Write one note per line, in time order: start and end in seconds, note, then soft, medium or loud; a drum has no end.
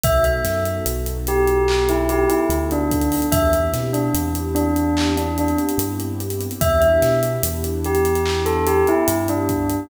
0.03 0.39 B1 medium
0.03 3.26 B3 medium
0.03 3.26 D#4 medium
0.03 3.26 F#4 medium
0.03 3.26 A4 loud
0.03 0.24 E5 medium
0.03 kick loud
0.03 closed hi-hat loud
0.24 0.58 E5 medium
0.24 closed hi-hat medium
0.45 0.79 F#2 medium
0.45 snare medium
0.45 closed hi-hat medium
0.65 closed hi-hat medium
0.86 2.26 B1 medium
0.86 closed hi-hat loud
1.06 closed hi-hat medium
1.27 1.84 G4 medium
1.27 closed hi-hat medium
1.47 closed hi-hat medium
1.68 clap loud
1.89 2.09 E4 medium
1.89 closed hi-hat medium
2.09 2.29 G4 medium
2.09 closed hi-hat medium
2.28 2.48 E4 medium
2.28 closed hi-hat medium
2.49 3.19 D2 medium
2.49 closed hi-hat medium
2.71 3.24 D4 medium
2.71 closed hi-hat medium
2.91 kick loud
2.91 closed hi-hat medium
3.01 closed hi-hat medium
3.12 open hi-hat medium
3.22 closed hi-hat medium
3.32 3.68 E2 medium
3.32 6.55 B3 medium
3.32 6.55 C4 medium
3.32 6.55 E4 medium
3.32 6.55 G4 medium
3.32 3.51 E5 medium
3.32 kick loud
3.32 closed hi-hat loud
3.53 closed hi-hat medium
3.73 4.08 B2 medium
3.73 snare medium
3.73 closed hi-hat medium
3.93 4.13 D4 medium
3.93 closed hi-hat medium
4.14 5.54 E2 medium
4.14 closed hi-hat loud
4.35 closed hi-hat medium
4.55 5.08 D4 medium
4.55 closed hi-hat medium
4.76 closed hi-hat medium
4.97 clap loud
5.17 5.36 D4 medium
5.17 closed hi-hat medium
5.38 5.58 D4 medium
5.38 closed hi-hat medium
5.48 closed hi-hat medium
5.58 closed hi-hat medium
5.69 closed hi-hat medium
5.78 6.48 G2 medium
5.78 closed hi-hat loud
6.00 closed hi-hat medium
6.20 closed hi-hat medium
6.30 closed hi-hat medium
6.41 closed hi-hat medium
6.51 closed hi-hat medium
6.61 6.97 E2 medium
6.61 9.83 B3 loud
6.61 9.83 D4 loud
6.61 9.83 E4 medium
6.61 9.83 G4 loud
6.61 6.80 E5 medium
6.61 kick loud
6.61 closed hi-hat loud
6.80 7.13 E5 medium
6.80 closed hi-hat medium
7.02 7.37 B2 medium
7.02 snare medium
7.02 closed hi-hat medium
7.23 closed hi-hat medium
7.43 8.83 E2 medium
7.43 closed hi-hat loud
7.64 closed hi-hat medium
7.84 8.39 G4 medium
7.84 closed hi-hat medium
7.95 closed hi-hat medium
8.05 closed hi-hat medium
8.15 closed hi-hat medium
8.26 clap loud
8.46 8.65 A4 medium
8.46 closed hi-hat medium
8.67 8.86 G4 medium
8.67 closed hi-hat medium
8.87 9.08 E4 medium
8.87 closed hi-hat medium
9.08 9.78 G2 medium
9.08 closed hi-hat loud
9.28 9.80 D4 medium
9.28 closed hi-hat medium
9.49 kick medium
9.49 closed hi-hat medium
9.70 closed hi-hat medium